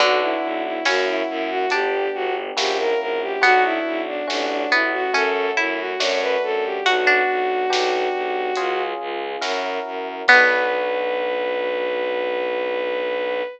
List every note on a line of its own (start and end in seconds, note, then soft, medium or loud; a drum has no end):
0.00 0.37 B1 loud
0.00 0.78 D3 medium
0.00 0.83 B3 medium
0.00 0.83 D4 medium
0.00 0.20 F#4 loud
0.00 0.83 F#4 medium
0.00 kick loud
0.00 closed hi-hat medium
0.21 0.63 E4 loud
0.43 0.79 B1 loud
0.65 0.85 E4 medium
0.85 1.22 F#2 loud
0.85 1.69 A#3 medium
0.85 1.24 C#4 medium
0.85 1.69 C#4 medium
0.85 1.69 E4 medium
0.85 1.69 F#4 medium
0.85 1.06 F#4 loud
0.85 snare loud
1.07 1.27 E4 medium
1.29 1.65 F#2 loud
1.29 1.49 E4 loud
1.50 1.71 F#4 loud
1.70 2.08 G1 loud
1.70 2.55 B3 medium
1.70 2.55 D4 loud
1.70 3.17 D4 medium
1.70 2.09 G4 loud
1.70 2.55 G4 medium
1.70 closed hi-hat loud
2.14 2.51 G1 loud
2.14 2.34 F#4 loud
2.57 2.94 A#1 loud
2.57 3.41 A#3 loud
2.57 3.41 C#4 medium
2.57 3.41 E4 medium
2.57 3.41 F#4 medium
2.57 2.77 G4 loud
2.57 snare loud
2.79 2.99 A#4 loud
3.00 3.36 A#1 medium
3.00 3.20 A#4 loud
3.22 3.42 G4 medium
3.41 3.79 B1 loud
3.41 4.25 B3 medium
3.41 3.96 B3 medium
3.41 4.25 D4 medium
3.41 4.25 F#4 loud
3.41 3.63 F#4 loud
3.41 kick loud
3.41 closed hi-hat loud
3.64 4.01 E4 loud
3.86 4.22 B1 loud
4.07 4.27 D4 loud
4.28 4.65 A1 loud
4.28 5.11 A3 medium
4.28 5.11 C#4 medium
4.28 4.49 D4 loud
4.28 5.11 F#4 loud
4.28 snare loud
4.49 4.70 D4 loud
4.71 5.08 A1 medium
4.71 5.13 B3 medium
4.71 4.92 E4 medium
4.93 5.13 F#4 loud
5.13 5.51 F#2 loud
5.13 5.98 A3 loud
5.13 5.98 C#4 medium
5.13 5.49 C#4 medium
5.13 5.98 F#4 medium
5.13 5.51 A4 loud
5.13 closed hi-hat medium
5.57 5.94 F#2 loud
5.57 6.37 E4 medium
5.57 5.78 E4 medium
5.79 5.99 F#4 loud
6.00 6.36 F#2 loud
6.00 6.84 A3 loud
6.00 6.84 D4 loud
6.00 6.84 F#4 loud
6.00 6.20 C#5 loud
6.00 snare loud
6.21 6.42 B4 loud
6.43 6.79 F#2 medium
6.43 6.64 A4 loud
6.65 6.85 G4 medium
6.86 7.22 B1 loud
6.86 7.69 B3 medium
6.86 7.69 D4 medium
6.86 8.81 F#4 loud
6.86 7.06 F#4 medium
6.86 7.71 F#4 medium
6.86 kick loud
6.86 closed hi-hat loud
7.07 7.96 D4 medium
7.29 7.65 B1 medium
7.70 8.08 B1 loud
7.70 8.54 B3 medium
7.70 8.54 D4 medium
7.70 8.54 G4 loud
7.70 snare loud
8.14 8.51 B1 medium
8.56 8.94 C#2 loud
8.56 9.41 C#4 medium
8.56 9.41 F4 loud
8.56 9.41 G#4 loud
8.56 closed hi-hat loud
9.00 9.36 C#2 loud
9.41 9.79 F#2 loud
9.41 10.25 C#4 medium
9.41 10.25 E4 medium
9.41 10.25 F#4 medium
9.41 10.25 A#4 loud
9.41 snare medium
9.86 10.22 F#2 medium
10.28 13.42 B1 loud
10.28 13.42 B3 loud
10.28 13.43 B3 loud
10.28 13.42 D4 loud
10.28 13.42 F#4 loud
10.28 13.43 B4 loud
10.28 kick loud
10.28 crash loud